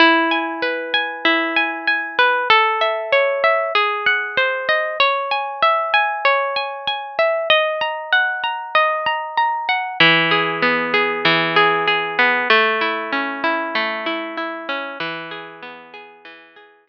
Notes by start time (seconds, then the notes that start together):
0.00 E4
0.31 G#5
0.62 B4
0.94 G#5
1.25 E4
1.56 G#5
1.88 G#5
2.19 B4
2.50 A4
2.81 E5
3.12 C#5
3.44 E5
3.75 G#4
4.06 F#5
4.37 C5
4.69 D#5
5.00 C#5
5.31 G#5
5.62 E5
5.94 G#5
6.25 C#5
6.56 G#5
6.87 G#5
7.19 E5
7.50 D#5
7.81 A#5
8.12 F#5
8.44 A#5
8.75 D#5
9.06 A#5
9.37 A#5
9.69 F#5
10.00 E3
10.31 G#4
10.62 B3
10.94 G#4
11.25 E3
11.56 G#4
11.88 G#4
12.19 B3
12.50 A3
12.81 E4
13.12 C#4
13.44 E4
13.75 A3
14.06 E4
14.37 E4
14.69 C#4
15.00 E3
15.31 G#4
15.62 B3
15.94 G#4
16.25 E3
16.56 G#4
16.87 G#4